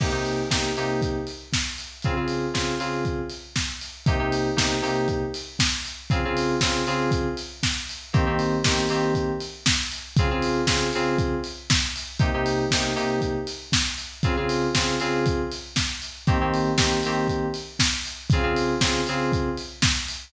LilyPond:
<<
  \new Staff \with { instrumentName = "Electric Piano 2" } { \time 4/4 \key c \phrygian \tempo 4 = 118 <c bes ees' g'>16 <c bes ees' g'>8. <c bes ees' g'>8 <c bes ees' g'>2~ <c bes ees' g'>8 | <des c' f' aes'>16 <des c' f' aes'>8. <des c' f' aes'>8 <des c' f' aes'>2~ <des c' f' aes'>8 | <c bes ees' g'>16 <c bes ees' g'>8. <c bes ees' g'>8 <c bes ees' g'>2~ <c bes ees' g'>8 | <des c' f' aes'>16 <des c' f' aes'>8. <des c' f' aes'>8 <des c' f' aes'>2~ <des c' f' aes'>8 |
<ees bes c' g'>16 <ees bes c' g'>8. <ees bes c' g'>8 <ees bes c' g'>2~ <ees bes c' g'>8 | <des c' f' aes'>16 <des c' f' aes'>8. <des c' f' aes'>8 <des c' f' aes'>2~ <des c' f' aes'>8 | <c bes ees' g'>16 <c bes ees' g'>8. <c bes ees' g'>8 <c bes ees' g'>2~ <c bes ees' g'>8 | <des c' f' aes'>16 <des c' f' aes'>8. <des c' f' aes'>8 <des c' f' aes'>2~ <des c' f' aes'>8 |
<ees bes c' g'>16 <ees bes c' g'>8. <ees bes c' g'>8 <ees bes c' g'>2~ <ees bes c' g'>8 | <des c' f' aes'>16 <des c' f' aes'>8. <des c' f' aes'>8 <des c' f' aes'>2~ <des c' f' aes'>8 | }
  \new DrumStaff \with { instrumentName = "Drums" } \drummode { \time 4/4 <cymc bd>8 hho8 <bd sn>8 hho8 <hh bd>8 hho8 <bd sn>8 hho8 | <hh bd>8 hho8 <bd sn>8 hho8 <hh bd>8 hho8 <bd sn>8 hho8 | <hh bd>8 hho8 <bd sn>8 hho8 <hh bd>8 hho8 <bd sn>8 hho8 | <hh bd>8 hho8 <bd sn>8 hho8 <hh bd>8 hho8 <bd sn>8 hho8 |
<hh bd>8 hho8 <bd sn>8 hho8 <hh bd>8 hho8 <bd sn>8 hho8 | <hh bd>8 hho8 <bd sn>8 hho8 <hh bd>8 hho8 <bd sn>8 hho8 | <hh bd>8 hho8 <bd sn>8 hho8 <hh bd>8 hho8 <bd sn>8 hho8 | <hh bd>8 hho8 <bd sn>8 hho8 <hh bd>8 hho8 <bd sn>8 hho8 |
<hh bd>8 hho8 <bd sn>8 hho8 <hh bd>8 hho8 <bd sn>8 hho8 | <hh bd>8 hho8 <bd sn>8 hho8 <hh bd>8 hho8 <bd sn>8 hho8 | }
>>